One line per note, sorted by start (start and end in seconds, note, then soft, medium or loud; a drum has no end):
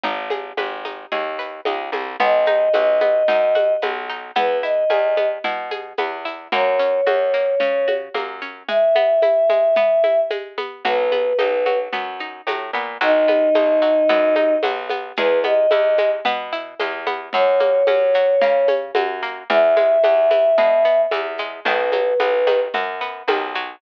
0.03 0.53 G#1 medium
0.03 0.84 D#4 loud
0.03 low conga loud
0.03 shaker medium
0.30 1.11 G#4 medium
0.30 high conga medium
0.30 shaker medium
0.57 1.06 G#1 medium
0.57 1.38 B4 medium
0.57 high conga medium
0.57 shaker medium
0.85 1.65 D#4 medium
0.85 high conga medium
0.85 shaker medium
1.12 1.61 D#2 medium
1.12 1.93 G#4 medium
1.12 low conga medium
1.12 shaker medium
1.39 2.16 B4 medium
1.39 shaker medium
1.65 1.91 C#2 medium
1.65 2.17 D#4 medium
1.65 high conga loud
1.65 shaker medium
1.92 2.17 C2 medium
1.92 2.19 G#4 medium
1.92 high conga medium
1.92 shaker medium
2.20 2.69 B1 medium
2.20 3.01 B3 loud
2.20 3.73 D#5 medium
2.20 low conga loud
2.20 shaker medium
2.46 3.28 D#4 medium
2.46 high conga medium
2.46 shaker medium
2.74 3.23 B1 medium
2.74 3.55 F#4 medium
2.74 high conga medium
2.74 shaker medium
3.00 3.82 B3 medium
3.00 high conga medium
3.00 shaker medium
3.28 3.77 F#2 medium
3.28 4.09 D#4 medium
3.28 low conga loud
3.28 shaker loud
3.55 4.32 F#4 medium
3.55 high conga medium
3.55 shaker medium
3.82 4.31 B1 medium
3.82 4.34 B3 medium
3.82 high conga medium
3.82 shaker medium
4.09 4.35 D#4 medium
4.09 shaker medium
4.35 4.84 E2 medium
4.35 5.17 B3 loud
4.35 4.58 B4 medium
4.35 low conga loud
4.35 shaker medium
4.63 5.44 E4 medium
4.63 5.28 D#5 medium
4.63 shaker medium
4.90 5.39 E2 medium
4.90 5.71 G#4 medium
4.90 high conga medium
4.90 shaker medium
5.17 5.98 B3 medium
5.17 high conga medium
5.17 shaker medium
5.44 5.93 B2 medium
5.44 6.25 E4 medium
5.44 low conga medium
5.44 shaker medium
5.71 6.48 G#4 medium
5.71 high conga medium
5.71 shaker medium
5.98 6.48 E2 medium
5.98 6.50 B3 medium
5.98 high conga medium
5.98 shaker medium
6.25 6.51 E4 medium
6.25 shaker medium
6.52 7.01 F#2 loud
6.52 7.33 A#3 loud
6.52 7.94 C#5 medium
6.52 low conga loud
6.52 shaker medium
6.79 7.60 C#4 medium
6.79 shaker medium
7.06 7.55 F#2 medium
7.06 7.87 F#4 medium
7.06 high conga loud
7.06 shaker medium
7.34 8.14 A#3 medium
7.34 shaker medium
7.60 8.09 C#3 medium
7.60 8.41 C#4 medium
7.60 low conga medium
7.60 shaker medium
7.88 8.65 F#4 medium
7.88 high conga medium
7.88 shaker medium
8.14 8.63 F#2 medium
8.14 8.66 A#3 medium
8.14 high conga medium
8.14 shaker medium
8.41 8.67 C#4 medium
8.41 shaker medium
8.68 9.49 G#3 medium
8.68 10.20 E5 medium
8.68 low conga loud
8.68 shaker medium
8.95 9.76 B3 medium
8.95 high conga medium
8.95 shaker medium
9.22 10.03 E4 medium
9.22 high conga medium
9.22 shaker medium
9.49 10.30 G#3 medium
9.49 high conga medium
9.49 shaker medium
9.76 10.57 B3 medium
9.76 low conga loud
9.76 shaker medium
10.04 10.81 E4 medium
10.04 high conga medium
10.04 shaker medium
10.30 10.82 G#3 medium
10.30 high conga loud
10.30 shaker medium
10.58 10.83 B3 medium
10.58 high conga medium
10.58 shaker medium
10.85 11.33 B1 medium
10.85 11.66 F#3 loud
10.85 11.79 B4 medium
10.85 low conga loud
10.85 shaker medium
11.12 11.92 B3 medium
11.12 high conga medium
11.12 shaker medium
11.38 11.89 B1 medium
11.38 12.20 D#4 medium
11.38 high conga loud
11.38 shaker medium
11.66 12.47 F#3 medium
11.66 high conga medium
11.66 shaker medium
11.93 12.41 F#2 medium
11.93 12.74 B3 medium
11.93 low conga medium
11.93 shaker medium
12.19 12.97 D#4 medium
12.19 shaker medium
12.47 12.71 A2 medium
12.47 12.99 F#3 medium
12.47 high conga medium
12.47 shaker loud
12.73 12.98 A#2 medium
12.73 13.00 B3 medium
12.73 shaker medium
13.01 13.50 B1 medium
13.01 13.81 F#3 loud
13.01 14.54 D#4 loud
13.01 shaker loud
13.28 14.09 B3 medium
13.28 high conga medium
13.28 shaker medium
13.55 14.04 B1 medium
13.55 14.36 D#4 medium
13.55 high conga loud
13.55 shaker medium
13.82 14.63 F#3 medium
13.82 shaker medium
14.09 14.58 F#2 medium
14.09 14.90 B3 loud
14.09 low conga loud
14.09 shaker medium
14.36 15.13 D#4 medium
14.36 high conga medium
14.36 shaker medium
14.63 15.12 B1 medium
14.63 15.15 F#3 medium
14.63 high conga loud
14.63 shaker loud
14.89 15.16 B3 medium
14.89 high conga medium
14.89 shaker medium
15.17 15.67 E2 medium
15.17 15.98 G#3 loud
15.17 15.39 B4 medium
15.17 low conga loud
15.17 shaker loud
15.44 16.25 B3 medium
15.44 16.10 D#5 medium
15.44 high conga medium
15.44 shaker medium
15.71 16.21 E2 medium
15.71 16.52 E4 medium
15.71 high conga loud
15.71 shaker medium
15.98 16.79 G#3 medium
15.98 high conga medium
15.98 shaker medium
16.25 16.74 B2 medium
16.25 17.06 B3 loud
16.25 low conga loud
16.25 shaker loud
16.52 17.30 E4 medium
16.52 shaker medium
16.80 17.29 E2 medium
16.80 17.31 G#3 medium
16.80 high conga medium
16.80 shaker loud
17.07 17.32 B3 medium
17.07 high conga medium
17.07 shaker medium
17.33 17.83 F#2 medium
17.33 18.14 F#3 loud
17.33 18.74 C#5 loud
17.33 low conga loud
17.33 shaker medium
17.60 18.41 A#3 medium
17.60 high conga medium
17.60 shaker medium
17.87 18.36 F#2 medium
17.87 18.68 C#4 medium
17.87 high conga loud
17.87 shaker medium
18.14 18.95 F#3 medium
18.14 shaker medium
18.41 18.91 C#3 medium
18.41 19.22 A#3 medium
18.41 low conga loud
18.41 shaker loud
18.68 19.46 C#4 medium
18.68 high conga loud
18.68 shaker medium
18.95 19.43 F#2 medium
18.95 19.47 F#3 medium
18.95 high conga loud
18.95 shaker medium
19.23 19.48 A#3 medium
19.23 shaker medium
19.50 19.99 E2 medium
19.50 20.30 E3 loud
19.50 21.01 E5 medium
19.50 low conga loud
19.50 shaker medium
19.77 20.57 G#3 medium
19.77 high conga medium
19.77 shaker medium
20.03 20.53 E2 medium
20.03 20.84 B3 medium
20.03 high conga loud
20.03 shaker loud
20.31 21.11 E3 medium
20.31 high conga medium
20.31 shaker medium
20.58 21.07 B2 loud
20.58 21.39 G#3 medium
20.58 low conga loud
20.58 shaker medium
20.85 21.62 B3 medium
20.85 shaker medium
21.11 21.60 E2 medium
21.11 21.63 E3 medium
21.11 high conga loud
21.11 shaker loud
21.38 21.65 G#3 medium
21.38 shaker medium
21.65 22.14 B1 medium
21.65 22.47 D#3 loud
21.65 22.60 B4 loud
21.65 low conga loud
21.65 shaker loud
21.92 22.74 F#3 medium
21.92 high conga medium
21.92 shaker medium
22.20 22.68 B1 medium
22.20 23.01 B3 medium
22.20 high conga medium
22.20 shaker medium
22.47 23.28 D#3 medium
22.47 high conga medium
22.47 shaker medium
22.74 23.23 F#2 medium
22.74 23.55 F#3 medium
22.74 low conga medium
22.74 shaker medium
23.01 23.78 B3 medium
23.01 shaker medium
23.28 23.76 B1 medium
23.28 23.79 D#3 medium
23.28 high conga loud
23.28 shaker medium
23.55 23.81 F#3 medium
23.55 shaker medium